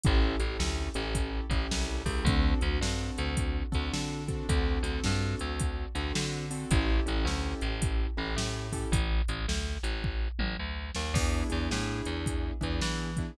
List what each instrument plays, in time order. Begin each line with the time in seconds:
0.03 electric bass (finger) A1, acoustic grand piano C#4 E4 G4 A4, kick, closed hi-hat
0.39 electric bass (finger) A1, acoustic grand piano C#4 E4 G4 A4, closed hi-hat
0.59 electric bass (finger) D2, snare
0.94 electric bass (finger) A1, acoustic grand piano C#4 E4 G4 A4, closed hi-hat
1.15 kick, closed hi-hat
1.50 electric bass (finger) A1, acoustic grand piano C#4 E4 G4 A4, kick, closed hi-hat
1.71 electric bass (finger) C2, snare
2.05 electric bass (finger) C#2, acoustic grand piano C#4 E4 G4 A4, kick, open hi-hat
2.25 electric bass (finger) D2, acoustic grand piano C4 D4 F#4 A4, kick, closed hi-hat
2.61 electric bass (finger) D2, acoustic grand piano C4 D4 F#4 A4, closed hi-hat
2.81 electric bass (finger) G2, acoustic grand piano C4 D4 F#4 A4, snare
3.18 electric bass (finger) D2, closed hi-hat
3.37 kick, closed hi-hat
3.72 electric bass (finger) D2, acoustic grand piano C4 D4 F#4 A4, kick, closed hi-hat
3.93 electric bass (finger) D3, snare
4.28 acoustic grand piano C4 D4 F#4 A4, kick, closed hi-hat
4.49 electric bass (finger) D2, acoustic grand piano C4 D4 F#4 A4, kick, closed hi-hat
4.83 electric bass (finger) D2, acoustic grand piano C4 D4 F#4 A4, closed hi-hat
5.04 electric bass (finger) G2, acoustic grand piano C4 D4 F#4 A4, snare
5.39 electric bass (finger) D2, closed hi-hat
5.59 kick, closed hi-hat
5.95 electric bass (finger) D2, acoustic grand piano C4 D4 F#4 A4, closed hi-hat
6.15 electric bass (finger) D3, snare
6.51 acoustic grand piano C4 D4 F#4 A4, open hi-hat
6.71 electric bass (finger) A1, acoustic grand piano C#4 E4 G4 A4, kick, closed hi-hat
7.06 electric bass (finger) A1, acoustic grand piano C#4 E4 G4 A4, closed hi-hat
7.25 electric bass (finger) D2, acoustic grand piano C#4 E4 G4 A4, snare
7.61 electric bass (finger) A1, closed hi-hat
7.82 kick, closed hi-hat
8.17 electric bass (finger) A1, acoustic grand piano C#4 E4 G4 A4
8.36 electric bass (finger) A2, snare
8.72 acoustic grand piano C#4 E4 G4 A4, kick, open hi-hat
8.92 electric bass (finger) A1, kick, closed hi-hat
9.28 electric bass (finger) A1, closed hi-hat
9.48 electric bass (finger) D2, snare
9.83 electric bass (finger) A1, closed hi-hat
10.04 kick
10.39 electric bass (finger) A1, mid tom
10.59 electric bass (finger) D2
10.95 electric bass (finger) D#2, snare
11.14 electric bass (finger) E2, acoustic grand piano B3 D4 E4 G#4, kick, crash
11.50 electric bass (finger) E2, acoustic grand piano B3 D4 E4 G#4, closed hi-hat
11.70 electric bass (finger) A2, acoustic grand piano B3 D4 E4 G#4, snare
12.05 electric bass (finger) E2, closed hi-hat
12.26 kick, closed hi-hat
12.61 electric bass (finger) E2, acoustic grand piano B3 D4 E4 G#4, kick, closed hi-hat
12.81 electric bass (finger) E3, snare
13.17 acoustic grand piano B3 D4 E4 G#4, kick, closed hi-hat